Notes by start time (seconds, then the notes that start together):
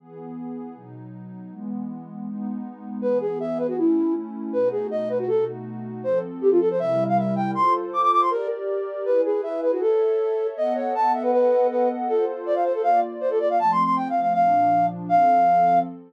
0.00 E3 B3 G#4
0.75 B2 F#3 D#4
1.51 E3 G#3 B3
2.27 G#3 B3 D#4
3.02 E3 B3 G#4 B4
3.21 G#4
3.40 E5
3.58 B4
3.68 F#4
3.77 A3 C#4 E4
4.53 B2 A3 D#4 F#4 B4
4.71 G#4
4.91 D#5
5.09 B4
5.19 F#4
5.28 B2 A3 D#4 F#4 A4
6.04 F3 C4 A4 C5
6.41 G4
6.51 F4
6.60 A4
6.70 C5
6.78 C3 G3 E4 A#4 E5
7.08 F5
7.17 E5
7.36 G5
7.53 F4 A4 C5 C6
7.93 D6
8.02 D6
8.12 D6
8.21 C6
8.30 G4 A#4 D5
9.05 E4 G#4 B4
9.25 G#4
9.43 E5
9.62 B4
9.72 F#4
9.81 A4 C#5 E5
10.56 B3 A4 D#5 F#5
10.75 C#5
10.95 A5
11.14 E5
11.23 B4
11.32 B3 A4 B4 D#5 F#5
11.70 B4
12.08 F4 A4 C5
12.46 D5
12.55 F5
12.64 C5
12.74 A4
12.82 A#3 F4 D5 F5
13.21 C5
13.30 A4
13.40 D5
13.50 F5
13.59 F3 A3 C4 A5
13.71 C6
13.84 C6
13.96 G5
14.09 F5
14.21 F5
14.33 A#2 F3 D4 F5
15.09 F3 C4 A4 F5